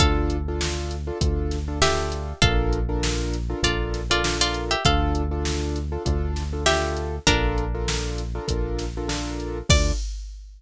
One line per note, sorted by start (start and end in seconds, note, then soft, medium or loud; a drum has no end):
0.00 1.11 D2 loud
0.00 0.37 D4 loud
0.00 0.37 F4 loud
0.00 0.37 A4 loud
0.00 0.55 A4 medium
0.00 0.55 F5 medium
0.00 kick medium
0.00 closed hi-hat medium
0.30 closed hi-hat medium
0.48 0.95 D4 medium
0.48 0.95 F4 loud
0.48 0.95 A4 loud
0.61 snare medium
0.91 closed hi-hat medium
1.07 1.18 D4 loud
1.07 1.18 F4 loud
1.07 1.18 A4 loud
1.21 2.33 D2 loud
1.21 1.58 D4 medium
1.21 1.58 F4 medium
1.21 1.58 A4 loud
1.21 kick medium
1.21 closed hi-hat loud
1.51 snare soft
1.51 closed hi-hat medium
1.68 1.79 D4 loud
1.68 1.79 F4 loud
1.68 1.79 A4 medium
1.82 2.33 D4 medium
1.82 2.33 F4 loud
1.82 2.40 G4 medium
1.82 2.33 A4 loud
1.82 2.40 E5 loud
1.82 snare loud
2.12 closed hi-hat medium
2.42 3.54 A#1 loud
2.42 2.79 D4 loud
2.42 2.79 F4 loud
2.42 3.46 A4 medium
2.42 2.79 A4 loud
2.42 2.79 A#4 loud
2.42 3.46 F5 loud
2.42 kick medium
2.42 closed hi-hat medium
2.73 closed hi-hat medium
2.89 3.36 D4 loud
2.89 3.36 F4 medium
2.89 3.36 A4 medium
2.89 3.36 A#4 loud
3.03 snare medium
3.33 closed hi-hat medium
3.50 3.61 D4 loud
3.50 3.61 F4 loud
3.50 3.61 A4 loud
3.50 3.61 A#4 loud
3.63 4.75 A#1 medium
3.63 4.01 D4 loud
3.63 4.01 F4 medium
3.63 4.04 F4 medium
3.63 4.01 A4 loud
3.63 4.01 A#4 medium
3.63 4.04 D5 medium
3.63 kick medium
3.63 closed hi-hat medium
3.94 snare soft
3.94 closed hi-hat medium
4.10 4.21 D4 medium
4.10 4.21 F4 loud
4.10 4.37 F4 medium
4.10 4.21 A4 loud
4.10 4.21 A#4 medium
4.10 4.37 D5 medium
4.24 4.74 D4 loud
4.24 4.74 F4 loud
4.24 4.74 A4 medium
4.24 4.74 A#4 loud
4.24 snare medium
4.41 4.65 F4 medium
4.41 4.65 D5 medium
4.54 closed hi-hat medium
4.71 4.84 G4 medium
4.71 4.84 E5 medium
4.85 5.97 D2 loud
4.85 5.23 D4 loud
4.85 5.23 F4 loud
4.85 5.44 A4 medium
4.85 5.23 A4 loud
4.85 5.44 F5 medium
4.85 kick medium
4.85 closed hi-hat medium
5.15 closed hi-hat medium
5.31 5.79 D4 loud
5.31 5.79 F4 loud
5.31 5.79 A4 loud
5.45 snare medium
5.76 closed hi-hat medium
5.92 6.03 D4 loud
5.92 6.03 F4 loud
5.92 6.03 A4 loud
6.05 7.19 D2 loud
6.05 6.42 D4 loud
6.05 6.42 F4 loud
6.05 6.42 A4 loud
6.05 kick medium
6.05 closed hi-hat medium
6.36 snare soft
6.36 closed hi-hat medium
6.53 6.64 D4 medium
6.53 6.64 F4 medium
6.53 6.64 A4 loud
6.66 7.15 D4 medium
6.66 7.15 F4 loud
6.66 7.19 G4 medium
6.66 7.15 A4 loud
6.66 7.19 E5 medium
6.66 snare medium
6.97 closed hi-hat medium
7.27 8.40 A#1 loud
7.27 8.12 D4 medium
7.27 7.64 D4 loud
7.27 7.64 F4 loud
7.27 7.64 A4 loud
7.27 8.12 A#4 medium
7.27 7.64 A#4 loud
7.27 kick medium
7.27 closed hi-hat medium
7.58 closed hi-hat soft
7.75 8.22 D4 loud
7.75 8.22 F4 loud
7.75 8.22 A4 medium
7.75 8.22 A#4 loud
7.88 snare medium
8.18 closed hi-hat medium
8.35 8.46 D4 loud
8.35 8.46 F4 loud
8.35 8.46 A4 loud
8.35 8.46 A#4 loud
8.48 9.62 A#1 medium
8.48 8.85 D4 loud
8.48 8.85 F4 loud
8.48 8.85 A4 medium
8.48 8.85 A#4 loud
8.48 kick medium
8.48 closed hi-hat medium
8.79 snare soft
8.79 closed hi-hat medium
8.97 9.08 D4 loud
8.97 9.08 F4 loud
8.97 9.08 A4 loud
8.97 9.08 A#4 loud
9.08 9.58 D4 loud
9.08 9.58 F4 loud
9.08 9.58 A4 loud
9.08 9.58 A#4 loud
9.08 snare medium
9.40 closed hi-hat soft
9.69 9.92 D2 loud
9.69 9.91 D4 loud
9.69 9.91 F4 medium
9.69 9.91 A4 medium
9.69 9.92 D5 loud
9.69 kick loud
9.69 crash loud